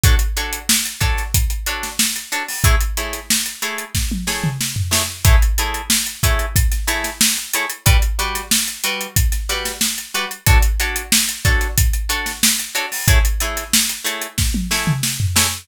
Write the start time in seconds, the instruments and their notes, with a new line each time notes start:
0.04 acoustic guitar (steel) D4 F#4 A4 C#5, kick, closed hi-hat
0.19 closed hi-hat
0.37 acoustic guitar (steel) D4 F#4 A4 C#5, closed hi-hat
0.53 closed hi-hat
0.69 snare
0.85 closed hi-hat
1.01 acoustic guitar (steel) D4 F#4 A4 C#5, kick, closed hi-hat
1.17 snare, closed hi-hat
1.34 kick, closed hi-hat
1.50 closed hi-hat
1.66 acoustic guitar (steel) D4 F#4 A4 C#5, closed hi-hat
1.83 snare, closed hi-hat
1.99 snare
2.16 closed hi-hat
2.32 acoustic guitar (steel) D4 F#4 A4 C#5, closed hi-hat
2.49 snare, open hi-hat
2.64 acoustic guitar (steel) A3 E4 G#4 C#5, kick, closed hi-hat
2.81 closed hi-hat
2.97 acoustic guitar (steel) A3 E4 G#4 C#5, closed hi-hat
3.13 snare, closed hi-hat
3.30 snare
3.46 closed hi-hat
3.62 acoustic guitar (steel) A3 E4 G#4 C#5, closed hi-hat
3.78 closed hi-hat
3.95 kick, snare
4.12 high tom
4.27 acoustic guitar (steel) A3 E4 G#4 C#5, snare
4.44 mid tom
4.61 snare
4.76 floor tom
4.91 acoustic guitar (steel) A3 E4 G#4 C#5, snare
5.25 acoustic guitar (steel) A3 E4 G#4 C#5, kick, closed hi-hat
5.42 closed hi-hat
5.58 acoustic guitar (steel) A3 E4 G#4 C#5, closed hi-hat
5.74 closed hi-hat
5.90 snare
6.06 closed hi-hat
6.23 acoustic guitar (steel) A3 E4 G#4 C#5, kick, closed hi-hat
6.39 closed hi-hat
6.56 kick, closed hi-hat
6.72 snare, closed hi-hat
6.87 acoustic guitar (steel) A3 E4 G#4 C#5, snare, closed hi-hat
7.04 snare, closed hi-hat
7.21 snare
7.37 snare, closed hi-hat
7.54 acoustic guitar (steel) A3 E4 G#4 C#5, closed hi-hat
7.70 closed hi-hat
7.86 acoustic guitar (steel) G3 F#4 B4 D5, kick, closed hi-hat
8.02 closed hi-hat
8.19 acoustic guitar (steel) G3 F#4 B4 D5, closed hi-hat
8.35 snare, closed hi-hat
8.51 snare
8.68 closed hi-hat
8.84 acoustic guitar (steel) G3 F#4 B4 D5, closed hi-hat
9.01 closed hi-hat
9.16 kick, closed hi-hat
9.32 snare, closed hi-hat
9.49 acoustic guitar (steel) G3 F#4 B4 D5, snare, closed hi-hat
9.65 snare, closed hi-hat
9.81 snare
9.98 closed hi-hat
10.14 acoustic guitar (steel) G3 F#4 B4 D5, closed hi-hat
10.31 closed hi-hat
10.46 acoustic guitar (steel) D4 F#4 A4 C#5, kick, closed hi-hat
10.63 closed hi-hat
10.80 acoustic guitar (steel) D4 F#4 A4 C#5, closed hi-hat
10.96 closed hi-hat
11.12 snare
11.29 closed hi-hat
11.45 acoustic guitar (steel) D4 F#4 A4 C#5, kick, closed hi-hat
11.61 snare, closed hi-hat
11.78 kick, closed hi-hat
11.93 closed hi-hat
12.09 acoustic guitar (steel) D4 F#4 A4 C#5, closed hi-hat
12.26 snare, closed hi-hat
12.43 snare
12.59 closed hi-hat
12.75 acoustic guitar (steel) D4 F#4 A4 C#5, closed hi-hat
12.92 snare, open hi-hat
13.07 acoustic guitar (steel) A3 E4 G#4 C#5, kick, closed hi-hat
13.25 closed hi-hat
13.40 acoustic guitar (steel) A3 E4 G#4 C#5, closed hi-hat
13.57 snare, closed hi-hat
13.74 snare
13.89 closed hi-hat
14.04 acoustic guitar (steel) A3 E4 G#4 C#5, closed hi-hat
14.22 closed hi-hat
14.38 kick, snare
14.54 high tom
14.71 acoustic guitar (steel) A3 E4 G#4 C#5, snare
14.87 mid tom
15.03 snare
15.20 floor tom
15.36 acoustic guitar (steel) A3 E4 G#4 C#5, snare